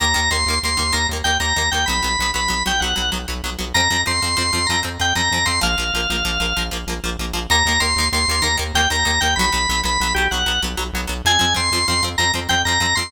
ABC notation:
X:1
M:12/8
L:1/8
Q:3/8=128
K:Eb
V:1 name="Drawbar Organ"
b2 c'2 c'2 b z g b2 g | _c'3 c'2 g _g2 z4 | b2 c'2 c'2 b z g b2 c' | f7 z5 |
b2 c'2 c'2 b z g b2 g | _c'3 c'2 G _g2 z4 | a2 c'2 c' z b z g b2 c' |]
V:2 name="Acoustic Guitar (steel)"
[E,B,] [E,B,] [E,B,] [E,B,] [E,B,] [E,B,] [E,B,] [E,B,] [E,B,] [E,B,] [E,B,] [E,B,] | [_G,_C] [G,C] [G,C] [G,C] [G,C] [G,C] [G,C] [G,C] [G,C] [G,C] [G,C] [G,C] | [F,C] [F,C] [F,C] [F,C] [F,C] [F,C] [F,C] [F,C] [F,C] [F,C] [F,C] [F,C] | [F,B,] [F,B,] [F,B,] [F,B,] [F,B,] [F,B,] [F,B,] [F,B,] [F,B,] [F,B,] [F,B,] [F,B,] |
[E,B,] [E,B,] [E,B,] [E,B,] [E,B,] [E,B,] [E,B,] [E,B,] [E,B,] [E,B,] [E,B,] [E,B,] | [_G,_C] [G,C] [G,C] [G,C] [G,C] [G,C] [G,C] [G,C] [G,C] [G,C] [G,C] [G,C] | [F,C] [F,C] [F,C] [F,C] [F,C] [F,C] [F,C] [F,C] [F,C] [F,C] [F,C] [F,C] |]
V:3 name="Synth Bass 1" clef=bass
E,, E,, E,, E,, E,, E,, E,, E,, E,, E,, E,, E,, | _C,, C,, C,, C,, C,, C,, C,, C,, C,, C,, C,, C,, | F,, F,, F,, F,, F,, F,, F,, F,, F,, F,, F,, F,, | B,,, B,,, B,,, B,,, B,,, B,,, B,,, B,,, B,,, B,,, B,,, B,,, |
E,, E,, E,, E,, E,, E,, E,, E,, E,, E,, E,, E,, | _C,, C,, C,, C,, C,, C,, C,, C,, C,, C,, C,, C,, | F,, F,, F,, F,, F,, F,, F,, F,, F,, F,, F,, F,, |]